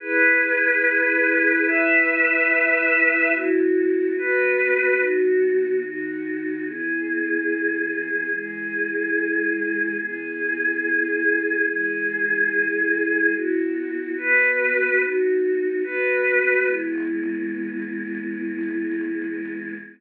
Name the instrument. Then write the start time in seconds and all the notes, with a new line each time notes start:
choir aahs
0.00 E4 G#4 B4
1.66 E4 B4 E5
3.33 B3 E4 F#4
4.17 B3 F#4 B4
4.99 D#3 B3 F#4
5.83 D#3 D#4 F#4
6.66 E3 B3 G#4
8.32 E3 G#3 G#4
10.00 E3 B3 G#4
11.68 E3 G#3 G#4
13.35 B3 E4 F#4
14.17 B3 F#4 B4
15.00 B3 D#4 F#4
15.84 B3 F#4 B4
16.67 E3 G#3 B3